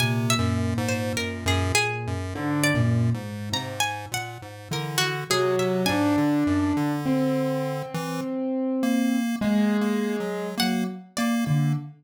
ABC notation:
X:1
M:5/4
L:1/16
Q:1/4=51
K:none
V:1 name="Acoustic Grand Piano"
_B,,8 (3D,2 B,,2 _A,,2 C, z3 E, z _G,2 | D4 C8 _A,4 _G, z2 D, |]
V:2 name="Lead 1 (square)"
(3C,2 _G,,2 _A,,2 G,, G,, z G,, (3A,,2 G,,2 A,,2 A,,2 _B,, A,, D,2 C, C, | _A,, D, _G,, D,4 E, z2 _B,2 (3B,2 B,2 _G,2 B, z B, B, |]
V:3 name="Orchestral Harp"
_a e z c _B _A A2 z d2 z _b a _g2 B _G A e | _a16 _g2 d2 |]